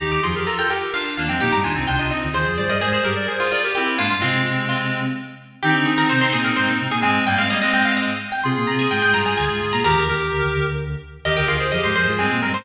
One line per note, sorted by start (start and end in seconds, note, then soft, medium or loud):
0.00 0.21 D#2 medium
0.00 0.21 D#3 medium
0.00 0.21 D#4 loud
0.00 0.21 G4 loud
0.00 0.11 A#5 medium
0.12 0.23 D6 loud
0.23 0.45 F2 medium
0.23 0.45 F3 medium
0.23 0.34 F4 medium
0.23 0.34 G#4 loud
0.23 0.44 C6 medium
0.36 0.47 G4 medium
0.36 0.47 A#4 loud
0.46 0.57 F4 medium
0.46 0.57 A4 loud
0.46 0.58 A#5 loud
0.58 0.69 F4 medium
0.58 0.69 A4 loud
0.58 0.70 G5 loud
0.69 0.91 G4 medium
0.69 0.91 A#4 medium
0.69 0.89 G5 medium
0.94 1.17 D4 medium
0.94 1.17 F4 medium
0.94 1.16 F5 loud
1.17 1.28 D#2 medium
1.17 1.28 D#3 medium
1.17 1.29 A#3 loud
1.17 1.29 D4 loud
1.17 1.29 F5 loud
1.29 1.40 F2 medium
1.29 1.40 F3 medium
1.29 1.40 G#3 medium
1.29 1.40 C4 medium
1.29 1.40 G5 loud
1.40 1.52 A#2 medium
1.40 1.52 A#3 medium
1.40 1.60 D#4 loud
1.40 1.60 G4 loud
1.40 1.52 G5 loud
1.52 1.63 G2 medium
1.52 1.63 G3 medium
1.52 1.64 A#5 loud
1.63 1.75 D#2 medium
1.63 1.75 D#3 medium
1.63 1.75 D4 medium
1.63 1.75 F4 loud
1.63 1.85 G#5 medium
1.75 1.87 C2 medium
1.75 1.87 C3 medium
1.75 1.86 C4 medium
1.75 1.86 D#4 loud
1.87 1.99 C2 medium
1.87 1.99 C3 medium
1.87 1.98 D4 medium
1.87 1.98 F4 loud
1.87 1.99 G5 medium
1.99 2.10 C2 medium
1.99 2.10 C3 medium
1.99 2.11 D4 medium
1.99 2.11 F4 medium
1.99 2.10 D#5 medium
2.09 2.29 C4 medium
2.09 2.29 D#4 medium
2.09 2.30 D#5 medium
2.23 2.34 D2 medium
2.23 2.34 D3 medium
2.33 2.45 D#2 medium
2.33 2.45 D#3 medium
2.33 2.55 F4 medium
2.33 2.55 G#4 medium
2.33 2.54 C5 loud
2.46 2.57 F2 medium
2.46 2.57 F3 medium
2.58 2.69 G2 medium
2.58 2.69 G3 medium
2.58 2.70 G#4 medium
2.58 2.70 C5 loud
2.58 2.69 D5 medium
2.69 2.80 G2 medium
2.69 2.80 G3 medium
2.69 2.80 A#4 medium
2.69 2.80 D5 loud
2.69 2.81 D#5 loud
2.81 3.00 G#2 medium
2.81 3.00 G#3 medium
2.81 2.92 G#4 medium
2.81 2.93 G#4 loud
2.81 2.92 C5 loud
2.93 3.04 G#4 medium
2.93 3.04 C5 loud
2.93 3.04 C5 medium
3.03 3.27 G2 medium
3.03 3.27 G3 medium
3.03 3.14 G4 medium
3.03 3.14 A#4 medium
3.03 3.26 A#4 medium
3.16 3.27 A#4 medium
3.16 3.27 D5 medium
3.28 3.39 G#4 loud
3.28 3.52 G#4 medium
3.28 3.52 C5 medium
3.40 3.51 F4 loud
3.51 3.74 F4 medium
3.51 3.62 A#4 medium
3.51 3.62 D5 loud
3.64 3.75 G4 medium
3.64 3.75 A#4 medium
3.75 3.97 C4 medium
3.75 3.97 E4 loud
3.75 3.95 G4 loud
3.97 4.10 G#2 medium
3.97 4.10 G#3 medium
3.97 4.08 A#3 medium
3.97 4.08 D4 loud
3.97 4.10 F4 loud
4.10 4.21 G2 medium
4.10 4.21 G3 medium
4.10 4.21 F4 loud
4.20 5.13 C3 medium
4.20 5.01 G#3 loud
4.20 5.01 C4 loud
4.20 5.13 C4 medium
4.20 4.65 F4 loud
4.69 5.29 F4 loud
5.63 5.74 D#3 medium
5.63 6.87 C4 loud
5.63 5.74 D#4 loud
5.63 6.87 D#4 loud
5.63 5.85 G4 loud
5.74 5.85 D3 medium
5.74 5.85 D4 medium
5.86 6.08 D#3 medium
5.86 6.08 D#4 medium
5.86 5.97 G#4 medium
5.98 6.09 A#4 loud
6.09 6.21 C3 medium
6.09 6.21 C4 medium
6.09 6.21 C5 loud
6.21 6.32 C3 medium
6.21 6.32 C4 medium
6.21 6.32 C5 loud
6.33 6.52 A#2 medium
6.33 6.52 A#3 medium
6.33 6.44 G#4 loud
6.45 6.56 A#4 loud
6.56 6.67 G#2 medium
6.56 6.67 G#3 medium
6.56 6.87 C5 loud
6.68 6.79 A#2 medium
6.68 6.79 A#3 medium
6.80 6.91 C3 medium
6.80 6.91 C4 medium
6.91 7.02 A#2 medium
6.91 7.02 A#3 medium
6.91 7.03 G#4 loud
7.01 7.22 G#2 medium
7.01 7.24 G#3 loud
7.01 7.22 G#3 medium
7.01 7.24 C4 loud
7.01 7.26 G#5 loud
7.26 7.37 G2 medium
7.26 7.37 G3 medium
7.26 7.38 G3 loud
7.26 7.38 A#3 loud
7.26 7.38 G5 loud
7.38 8.06 G#2 medium
7.38 7.49 G#3 medium
7.38 8.06 G#3 medium
7.38 7.49 C4 loud
7.38 7.50 F5 loud
7.50 7.61 G3 loud
7.50 7.61 A#3 loud
7.50 7.61 D#5 loud
7.62 8.11 G#3 loud
7.62 8.11 C4 loud
7.62 7.73 D#5 loud
7.74 7.85 G5 loud
7.85 7.96 F5 loud
7.97 8.31 D#5 loud
8.32 8.43 G5 medium
8.44 8.55 C3 medium
8.44 8.55 C4 loud
8.44 9.80 F4 loud
8.44 9.80 G#4 loud
8.44 8.65 C6 loud
8.56 8.67 A#2 medium
8.56 8.67 A#3 medium
8.67 8.87 C3 medium
8.67 8.87 C4 medium
8.67 8.78 A#5 loud
8.79 8.90 G#5 loud
8.91 9.02 G#2 medium
8.91 9.02 G#3 medium
8.91 9.02 G5 loud
9.02 9.14 G#2 medium
9.02 9.14 G#3 medium
9.02 9.13 G5 loud
9.14 9.35 G2 medium
9.14 9.35 G3 medium
9.14 9.25 A#5 loud
9.26 9.37 G#5 loud
9.37 9.49 D2 medium
9.37 9.49 D3 medium
9.37 9.71 G#5 loud
9.49 9.60 G#2 medium
9.49 9.60 G#3 medium
9.61 9.72 G#2 medium
9.61 9.72 G#3 medium
9.72 9.83 A#2 medium
9.72 9.83 A#3 medium
9.72 9.84 A#5 loud
9.84 9.95 D#2 medium
9.84 9.95 D#3 medium
9.84 10.03 G4 loud
9.84 10.03 A#4 loud
9.84 10.50 A#5 loud
9.96 10.07 D#2 medium
9.96 10.07 D#3 medium
10.08 10.31 D#2 medium
10.08 10.31 D#3 medium
10.08 10.66 G4 loud
10.08 10.66 A#4 loud
10.31 10.42 D2 medium
10.31 10.42 D3 medium
10.43 10.54 D2 medium
10.43 10.54 D3 medium
10.55 10.96 D2 medium
10.55 10.96 D3 medium
11.25 11.36 D#2 medium
11.25 11.36 D#3 medium
11.25 11.36 G4 loud
11.25 11.36 A#4 loud
11.25 11.36 D#5 loud
11.37 11.48 D2 medium
11.37 11.48 D3 medium
11.37 11.48 G4 loud
11.37 11.48 A#4 loud
11.37 11.48 G5 medium
11.47 11.71 D2 medium
11.47 11.71 D3 medium
11.47 11.58 F4 medium
11.47 11.58 G#4 loud
11.47 11.68 F5 loud
11.60 11.71 G#4 medium
11.60 11.71 C5 loud
11.72 11.83 F2 medium
11.72 11.83 F3 medium
11.72 11.95 G4 medium
11.72 11.95 A#4 medium
11.72 11.83 D#5 medium
11.83 11.95 G#2 medium
11.83 11.95 G#3 medium
11.83 11.95 C5 loud
11.95 12.06 F2 medium
11.95 12.06 F3 medium
11.95 12.07 G#4 loud
11.95 12.18 C5 loud
11.95 12.07 C5 loud
12.07 12.18 G#2 medium
12.07 12.18 G#3 medium
12.07 12.20 F4 medium
12.07 12.20 G#4 medium
12.19 12.30 G2 medium
12.19 12.30 G3 medium
12.19 12.40 G#3 medium
12.19 12.40 C4 loud
12.19 12.40 G#4 loud
12.30 12.42 A#2 medium
12.30 12.42 A#3 medium
12.41 12.53 G2 medium
12.41 12.53 G3 medium
12.41 12.53 G#3 medium
12.41 12.53 C4 loud
12.41 12.53 A#4 medium
12.54 12.65 G#2 medium
12.54 12.65 G#3 medium
12.54 12.65 C5 loud